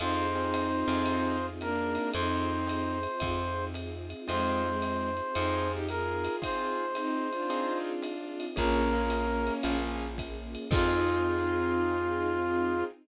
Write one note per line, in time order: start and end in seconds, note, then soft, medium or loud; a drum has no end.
0.00 0.84 F2 loud
0.00 1.06 C4 medium
0.00 1.37 C4 loud
0.00 0.26 C4 medium
0.00 1.06 D#4 medium
0.00 1.37 D#4 loud
0.00 0.26 D#4 medium
0.00 1.06 F4 medium
0.00 0.26 F4 medium
0.00 1.06 G#4 medium
0.00 0.26 G#4 medium
0.00 1.46 C5 medium
0.00 ride medium
0.35 0.68 C4 medium
0.35 0.68 D#4 medium
0.35 0.68 F4 medium
0.35 0.68 G#4 medium
0.54 hi-hat pedal medium
0.54 ride medium
0.87 1.98 F2 loud
0.87 1.49 C4 medium
0.87 1.49 D#4 medium
0.87 1.49 F4 medium
0.87 1.49 G#4 medium
0.87 ride medium
1.06 2.13 C4 medium
1.06 2.13 D#4 medium
1.06 2.13 F4 medium
1.06 2.13 G#4 medium
1.06 ride medium
1.61 2.11 A#3 loud
1.61 2.11 D4 loud
1.61 2.10 A#4 medium
1.61 hi-hat pedal medium
1.61 ride medium
1.95 ride medium
2.14 3.07 F2 loud
2.14 3.21 C4 medium
2.14 2.98 C4 loud
2.14 3.21 D#4 medium
2.14 2.98 D#4 loud
2.14 3.21 F4 medium
2.14 3.21 G#4 medium
2.14 3.65 C5 medium
2.14 ride loud
2.67 hi-hat pedal medium
2.67 ride medium
3.03 ride medium
3.20 4.14 F2 loud
3.20 4.28 C4 medium
3.20 4.28 D#4 medium
3.20 4.28 F4 medium
3.20 4.28 G#4 medium
3.20 kick medium
3.20 ride loud
3.74 hi-hat pedal medium
3.74 ride medium
4.10 ride medium
4.27 5.21 F2 loud
4.27 4.63 G#3 medium
4.27 4.70 C4 medium
4.27 4.63 C4 loud
4.27 5.35 C4 medium
4.27 4.70 D#4 medium
4.27 5.35 D#4 medium
4.27 4.70 F4 medium
4.27 5.35 F4 medium
4.27 4.70 G#4 medium
4.27 5.35 G#4 medium
4.27 5.72 C5 medium
4.27 ride medium
4.64 5.10 G#3 medium
4.64 5.10 C4 loud
4.82 hi-hat pedal medium
4.82 ride medium
5.17 ride medium
5.35 6.28 F2 loud
5.35 5.68 C4 medium
5.35 6.42 C4 medium
5.35 5.78 C4 medium
5.35 5.68 D#4 loud
5.35 6.42 D#4 medium
5.35 5.78 D#4 medium
5.35 6.42 F4 medium
5.35 5.78 F4 medium
5.35 6.42 G#4 medium
5.35 5.78 G#4 medium
5.35 ride loud
5.72 5.87 D#4 medium
5.72 5.87 G4 loud
5.88 6.40 F4 medium
5.88 6.40 G#4 medium
5.88 6.36 A#4 medium
5.88 hi-hat pedal medium
5.88 ride medium
6.25 ride medium
6.42 6.84 C4 medium
6.42 7.49 C4 medium
6.42 6.84 D#4 medium
6.42 7.49 D#4 medium
6.42 6.84 F4 medium
6.42 7.49 F4 medium
6.42 6.84 G#4 medium
6.42 7.49 G#4 medium
6.42 7.78 C5 medium
6.42 kick medium
6.42 ride loud
6.95 7.29 C4 medium
6.95 7.29 D#4 loud
6.95 hi-hat pedal medium
6.95 ride medium
7.31 8.46 D4 medium
7.31 8.46 F4 loud
7.31 ride medium
7.50 7.92 C4 medium
7.50 8.56 C4 medium
7.50 7.92 D#4 medium
7.50 8.56 D#4 medium
7.50 7.92 F4 medium
7.50 8.56 F4 medium
7.50 7.92 G#4 medium
7.50 8.56 G#4 medium
7.50 ride medium
8.02 hi-hat pedal medium
8.02 ride medium
8.40 ride medium
8.56 9.50 A#1 loud
8.56 8.81 A#3 medium
8.56 9.77 A#3 loud
8.56 9.64 A#3 medium
8.56 8.81 C#4 medium
8.56 9.77 C#4 loud
8.56 9.64 C#4 medium
8.56 8.81 F4 medium
8.56 9.64 F4 medium
8.56 8.81 G#4 medium
8.56 9.64 G#4 medium
8.56 9.53 A#4 medium
8.56 kick medium
8.56 ride medium
8.93 9.26 A#3 medium
8.93 9.26 C#4 medium
8.93 9.26 F4 medium
8.93 9.26 G#4 medium
9.10 hi-hat pedal medium
9.10 ride medium
9.47 ride medium
9.63 10.57 A#1 medium
9.63 10.06 A#3 medium
9.63 10.71 A#3 medium
9.63 10.06 C#4 medium
9.63 10.71 C#4 medium
9.63 10.06 F4 medium
9.63 10.71 F4 medium
9.63 10.06 G#4 medium
9.63 10.71 G#4 medium
9.63 ride loud
10.18 kick medium
10.18 hi-hat pedal medium
10.18 ride medium
10.55 ride medium
10.71 12.83 F2 loud
10.71 12.84 C4 loud
10.71 12.85 C4 medium
10.71 12.84 D#4 loud
10.71 12.85 D#4 loud
10.71 12.83 F4 loud
10.71 12.84 F4 loud
10.71 12.85 F4 medium
10.71 12.84 G#4 loud
10.71 12.85 G#4 loud
10.71 kick loud
10.71 crash loud